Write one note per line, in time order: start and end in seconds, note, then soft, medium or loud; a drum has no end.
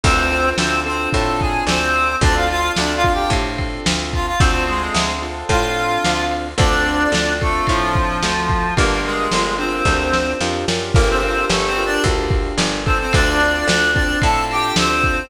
0.04 0.53 D2 loud
0.04 0.49 C4 medium
0.04 0.30 C4 loud
0.04 0.30 D4 medium
0.04 0.30 F4 medium
0.04 0.30 A4 medium
0.04 0.49 C5 medium
0.04 kick medium
0.04 crash loud
0.32 0.82 C4 medium
0.32 0.82 D4 medium
0.32 0.82 F4 medium
0.32 0.82 A4 medium
0.32 ride medium
0.58 1.08 D2 medium
0.58 0.80 C4 medium
0.58 0.80 C5 medium
0.58 snare loud
0.86 2.11 C4 medium
0.86 1.09 C4 medium
0.86 2.11 D4 medium
0.86 2.11 F4 medium
0.86 2.11 A4 medium
0.86 1.09 C5 medium
0.86 ride medium
1.13 1.63 A2 medium
1.13 1.40 A4 medium
1.13 1.40 A5 medium
1.13 kick medium
1.13 ride medium
1.40 1.64 G#4 medium
1.40 1.64 G#5 medium
1.40 kick medium
1.40 ride medium
1.67 2.16 D2 medium
1.67 2.15 C4 medium
1.67 2.15 C5 medium
1.67 snare loud
1.96 ride medium
2.21 2.70 D2 medium
2.21 2.47 C4 loud
2.21 2.35 D4 medium
2.21 2.47 D4 loud
2.21 2.47 F4 loud
2.21 2.47 A4 loud
2.21 2.35 D5 medium
2.21 kick medium
2.21 ride medium
2.36 2.49 F4 medium
2.36 2.49 F5 medium
2.50 3.00 C4 medium
2.50 3.00 D4 medium
2.50 3.00 F4 medium
2.50 2.72 F4 medium
2.50 3.00 A4 medium
2.50 2.72 F5 medium
2.50 ride medium
2.76 3.27 D2 medium
2.76 2.93 D4 medium
2.76 2.93 D5 medium
2.76 snare medium
2.96 3.13 F4 medium
2.96 3.13 F5 medium
3.04 4.30 C4 medium
3.04 4.30 D4 medium
3.04 4.30 F4 medium
3.04 4.30 A4 medium
3.04 kick medium
3.04 ride medium
3.13 3.30 G4 medium
3.13 3.30 G5 medium
3.30 3.79 A2 medium
3.30 kick medium
3.30 ride medium
3.58 kick medium
3.58 ride medium
3.86 4.35 D2 medium
3.86 snare loud
4.13 4.26 F4 medium
4.13 4.26 F5 medium
4.13 kick medium
4.13 ride medium
4.27 4.40 F4 medium
4.27 4.40 F5 medium
4.39 4.89 D2 medium
4.39 4.64 C4 medium
4.39 4.66 C4 loud
4.39 4.66 D4 medium
4.39 4.66 F4 medium
4.39 4.66 A4 medium
4.39 4.64 C5 medium
4.39 kick loud
4.39 ride loud
4.67 5.13 G#3 medium
4.67 5.18 C4 medium
4.67 5.18 D4 medium
4.67 5.18 F4 medium
4.67 5.13 G#4 medium
4.67 5.18 A4 medium
4.67 ride medium
4.94 5.44 D2 medium
4.94 snare loud
5.22 6.48 C4 medium
5.22 6.48 D4 medium
5.22 6.48 F4 medium
5.22 6.48 A4 medium
5.22 ride medium
5.49 5.98 A2 medium
5.49 6.24 F4 medium
5.49 6.24 F5 medium
5.49 kick medium
5.49 ride medium
5.77 ride medium
6.05 6.54 D2 medium
6.05 snare medium
6.31 ride medium
6.58 7.07 D2 medium
6.58 6.84 C4 medium
6.58 7.33 D4 medium
6.58 6.84 D4 loud
6.58 6.84 F4 loud
6.58 6.84 A4 loud
6.58 7.33 D5 medium
6.58 kick loud
6.58 ride medium
6.86 7.37 C4 loud
6.86 7.37 D4 medium
6.86 7.37 F4 medium
6.86 7.37 A4 medium
6.86 ride medium
7.12 7.61 D2 medium
7.12 snare loud
7.41 7.66 A3 medium
7.41 8.67 C4 medium
7.41 8.67 D4 medium
7.41 8.67 F4 medium
7.41 8.67 A4 medium
7.41 7.66 A4 medium
7.41 kick medium
7.41 ride medium
7.67 8.18 A2 medium
7.67 8.74 F3 medium
7.67 8.74 F4 medium
7.67 kick medium
7.67 ride medium
7.95 kick medium
7.95 ride medium
8.23 8.72 D2 medium
8.23 snare medium
8.50 kick medium
8.50 ride medium
8.76 9.27 G1 medium
8.76 9.01 A#3 medium
8.76 9.27 D4 medium
8.76 9.27 F4 loud
8.76 9.27 G4 loud
8.76 9.01 A#4 medium
8.76 9.27 A#4 loud
8.76 kick medium
8.76 ride medium
9.04 9.54 G#3 medium
9.04 9.54 G#4 medium
9.04 ride medium
9.31 9.82 G1 medium
9.31 9.57 D4 medium
9.31 9.57 F4 medium
9.31 9.57 G4 medium
9.31 9.57 A#4 medium
9.31 snare medium
9.58 10.33 C4 medium
9.58 9.84 D4 medium
9.58 9.84 F4 medium
9.58 9.84 G4 medium
9.58 9.84 A#4 medium
9.58 10.33 C5 medium
9.58 ride medium
9.85 10.34 D2 medium
9.85 10.37 D4 medium
9.85 10.37 F4 medium
9.85 10.37 G4 medium
9.85 10.37 A#4 medium
9.85 kick medium
9.85 snare medium
10.13 snare medium
10.40 10.65 F2 medium
10.40 10.66 D4 medium
10.40 10.66 F4 medium
10.40 10.66 G4 medium
10.40 10.66 A#4 medium
10.40 snare medium
10.68 10.93 F#2 medium
10.68 10.93 D4 medium
10.68 10.93 F4 medium
10.68 10.93 G4 medium
10.68 10.93 A#4 medium
10.68 snare medium
10.94 11.45 G1 medium
10.94 11.08 A#3 medium
10.94 11.20 D4 loud
10.94 11.20 F4 loud
10.94 11.20 G4 loud
10.94 11.20 A#4 loud
10.94 11.08 A#4 medium
10.94 kick loud
10.94 crash medium
11.10 11.23 C4 medium
11.10 11.23 C5 medium
11.23 11.45 C4 medium
11.23 11.73 D4 medium
11.23 11.73 F4 medium
11.23 11.73 G4 medium
11.23 11.73 A#4 loud
11.23 11.45 C5 medium
11.23 ride medium
11.49 11.99 G1 medium
11.49 11.67 A3 soft
11.49 11.67 A4 medium
11.49 snare loud
11.67 11.84 C4 medium
11.67 11.84 C5 medium
11.76 12.81 D4 medium
11.76 12.81 F4 medium
11.76 12.81 G4 medium
11.76 12.81 A#4 medium
11.76 ride medium
11.86 12.03 D4 medium
11.86 12.03 D5 medium
12.04 12.53 D2 medium
12.04 kick medium
12.04 ride medium
12.31 kick medium
12.31 ride medium
12.58 13.07 G1 medium
12.58 snare loud
12.85 12.98 C4 medium
12.85 13.39 C4 loud
12.85 13.39 D4 loud
12.85 13.39 F4 loud
12.85 13.39 A4 loud
12.85 12.98 C5 medium
12.85 kick medium
12.85 ride medium
13.00 13.13 C4 medium
13.00 13.13 C5 medium
13.13 13.63 D2 medium
13.13 13.66 D4 medium
13.13 13.66 D5 medium
13.13 kick medium
13.13 ride loud
13.40 13.90 C4 medium
13.40 13.90 D4 medium
13.40 13.90 F4 medium
13.40 13.90 A4 medium
13.40 ride medium
13.68 14.17 D2 medium
13.68 13.91 D4 medium
13.68 13.91 D5 medium
13.68 snare loud
13.94 15.20 C4 loud
13.94 14.19 D4 medium
13.94 15.20 D4 medium
13.94 15.20 F4 medium
13.94 15.20 A4 medium
13.94 14.19 D5 medium
13.94 kick medium
13.94 ride medium
14.22 14.72 A2 medium
14.22 14.45 A4 medium
14.22 14.45 A5 medium
14.22 kick medium
14.22 ride medium
14.51 14.76 G4 medium
14.51 14.76 G5 medium
14.51 ride medium
14.76 15.26 D2 medium
14.76 15.25 C4 medium
14.76 15.25 C5 medium
14.76 snare loud
15.04 kick medium